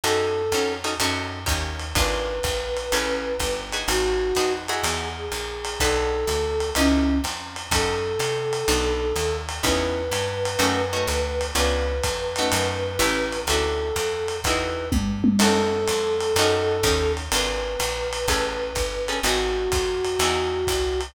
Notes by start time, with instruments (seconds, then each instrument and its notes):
0.04 electric bass (finger) F#2, acoustic guitar (steel) C#4 D#4 F#4 A4, flute A4, ride
0.52 electric bass (finger) F2, acoustic guitar (steel) C#4 D#4 F#4 A4, hi-hat pedal, ride
0.84 acoustic guitar (steel) C#4 D#4 F#4 A4, ride
1.00 electric bass (finger) F#2, acoustic guitar (steel) C#4 D#4 F#4 A4, ride
1.46 electric bass (finger) D#2, acoustic guitar (steel) C#4 D#4 G4 A#4, kick, hi-hat pedal, ride
1.79 ride
1.95 electric bass (finger) G#1, acoustic guitar (steel) D4 F4 G#4 B4, flute B4, kick, ride
2.43 electric bass (finger) A#1, kick, hi-hat pedal, ride
2.77 ride
2.92 electric bass (finger) A1, acoustic guitar (steel) C#4 G#4 A4 B4, ride
3.40 electric bass (finger) G1, kick, hi-hat pedal, ride
3.73 acoustic guitar (steel) D#4 F#4 G#4 B4, ride
3.88 electric bass (finger) G#1, flute F#4, ride
4.35 electric bass (finger) F2, acoustic guitar (steel) D#4 F#4 G#4 B4, hi-hat pedal, ride
4.68 acoustic guitar (steel) D#4 E4 F#4 G#4, flute G#4, ride
4.83 electric bass (finger) E2, ride
5.17 flute G#4
5.32 electric bass (finger) A#1, hi-hat pedal, ride
5.65 ride
5.80 electric bass (finger) B1, acoustic guitar (steel) D4 F#4 A4 B4, flute A4, kick, ride
6.27 electric bass (finger) D2, hi-hat pedal, ride
6.60 ride
6.75 electric bass (finger) C#2, flute C#4, acoustic guitar (steel) C#4 D#4 E4 B4, ride
7.24 electric bass (finger) F2, hi-hat pedal, ride
7.56 ride
7.71 electric bass (finger) F#2, acoustic guitar (steel) C#4 D#4 F#4 A4, flute A4, kick, ride
8.19 electric bass (finger) C3, hi-hat pedal, ride
8.53 ride
8.68 electric bass (finger) B1, acoustic guitar (steel) B3 D4 F#4 A4, ride
9.16 electric bass (finger) D#2, hi-hat pedal, ride
9.49 ride
9.63 electric bass (finger) E2, acoustic guitar (steel) B3 C#4 D#4 E4, flute B4, kick, ride
10.12 electric bass (finger) G2, hi-hat pedal, ride
10.45 ride
10.59 electric bass (finger) F#2, acoustic guitar (steel) A3 C#4 D#4 F#4, ride
10.93 acoustic guitar (steel) A3 C#4 D#4 F#4
11.07 electric bass (finger) D2, hi-hat pedal, ride
11.41 ride
11.55 electric bass (finger) C#2, acoustic guitar (steel) B3 C#4 D4 F4, flute B4, ride
12.04 electric bass (finger) F2, kick, hi-hat pedal, ride
12.36 acoustic guitar (steel) A3 C#4 D#4 F#4, ride
12.52 electric bass (finger) F#2, ride
12.99 electric bass (finger) A1, acoustic guitar (steel) A3 C#4 E4 G4, hi-hat pedal, ride
13.33 ride
13.47 electric bass (finger) D2, acoustic guitar (steel) C#4 D4 E4 F#4, flute A4, ride
13.96 electric bass (finger) F2, hi-hat pedal, ride
14.28 ride
14.44 electric bass (finger) E2, acoustic guitar (steel) D#4 E4 F#4 G#4, flute B4, kick, ride
14.92 electric bass (finger) G2, kick, high tom
15.24 high tom
15.39 electric bass (finger) F#2, acoustic guitar (steel) C#4 D#4 F#4 A4, flute A4, crash, ride
15.88 electric bass (finger) F2, hi-hat pedal, ride
16.21 ride
16.36 electric bass (finger) F#2, acoustic guitar (steel) C#4 D#4 F#4 A4, ride
16.83 electric bass (finger) D#2, acoustic guitar (steel) C#4 D#4 G4 A#4, kick, hi-hat pedal, ride
17.17 ride
17.32 electric bass (finger) G#1, acoustic guitar (steel) D4 F4 G#4 B4, flute B4, ride
17.80 electric bass (finger) A#1, hi-hat pedal, ride
18.13 ride
18.28 electric bass (finger) A1, acoustic guitar (steel) C#4 G#4 A4 B4, kick, ride
18.75 electric bass (finger) G1, kick, hi-hat pedal, ride
19.08 acoustic guitar (steel) C#4 G#4 A4 B4, ride
19.23 electric bass (finger) G#1, acoustic guitar (steel) D#4 F#4 G#4 B4, flute F#4, ride
19.72 electric bass (finger) F2, kick, hi-hat pedal, ride
20.05 ride
20.19 electric bass (finger) E2, acoustic guitar (steel) D#4 E4 F#4 G#4, ride
20.67 electric bass (finger) C2, kick, hi-hat pedal, ride
21.01 ride